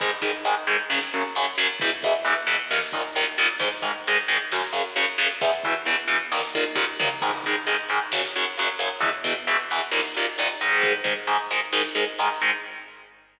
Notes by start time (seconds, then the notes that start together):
0.00 G#2 D#3 G#3, kick, crash
0.21 G#2 D#3 G#3, kick, closed hi-hat
0.45 G#2 D#3 G#3, closed hi-hat
0.67 G#2 D#3 G#3, closed hi-hat
0.90 F#2 C#3 F#3, snare
1.13 F#2 C#3 F#3, closed hi-hat
1.35 F#2 C#3 F#3, closed hi-hat
1.57 F#2 C#3 F#3, closed hi-hat
1.80 E2 B2 E3, kick, closed hi-hat
2.02 E2 B2 E3, kick, closed hi-hat
2.25 E2 B2 E3, closed hi-hat
2.47 E2 B2 E3, closed hi-hat
2.71 D#2 A#2 D#3, snare
2.92 D#2 A#2 D#3, kick, closed hi-hat
3.15 D#2 A#2 D#3, closed hi-hat
3.38 D#2 A#2 D#3, closed hi-hat
3.60 G#2 D#3 G#3, kick, closed hi-hat
3.82 G#2 D#3 G#3, kick, closed hi-hat
4.07 G#2 D#3 G#3, closed hi-hat
4.28 G#2 D#3 G#3, closed hi-hat
4.52 F#2 C#3 F#3, snare
4.72 F#2 C#3 F#3, closed hi-hat
4.96 F#2 C#3 F#3, closed hi-hat
5.18 F#2 C#3 F#3, open hi-hat
5.41 E2 B2 E3, kick, closed hi-hat
5.63 E2 B2 E3, kick, closed hi-hat
5.85 E2 B2 E3, closed hi-hat
6.08 E2 B2 E3, closed hi-hat
6.32 D#2 A#2 D#3, snare
6.54 D#2 A#2 D#3, kick, closed hi-hat
6.75 D#2 A#2 D#3, kick
7.00 D#2 A#2 D#3, mid tom
7.22 G#2 D#3 G#3, kick, crash
7.44 G#2 D#3 G#3, kick, closed hi-hat
7.67 G#2 D#3 G#3, closed hi-hat
7.89 G#2 D#3 G#3, closed hi-hat
8.12 F#2 C#3 F#3, snare
8.34 F#2 C#3 F#3, closed hi-hat
8.57 F#2 C#3 F#3, closed hi-hat
8.79 F#2 C#3 F#3, closed hi-hat
9.00 E2 B2 E3, kick, closed hi-hat
9.24 E2 B2 E3, kick, closed hi-hat
9.47 E2 B2 E3, closed hi-hat
9.70 E2 B2 E3, closed hi-hat
9.91 D#2 A#2 D#3, snare
10.15 D#2 A#2 D#3, closed hi-hat
10.38 D#2 A#2 D#3, closed hi-hat
10.61 G#2 D#3 G#3, closed hi-hat
10.81 kick, closed hi-hat
11.04 G#2 D#3 G#3, kick, closed hi-hat
11.27 G#2 D#3 G#3, closed hi-hat
11.50 G#2 D#3 G#3, closed hi-hat
11.73 G#2 D#3 G#3, snare
11.95 G#2 D#3 G#3, closed hi-hat
12.19 G#2 D#3 G#3, closed hi-hat
12.41 G#2 D#3 G#3, closed hi-hat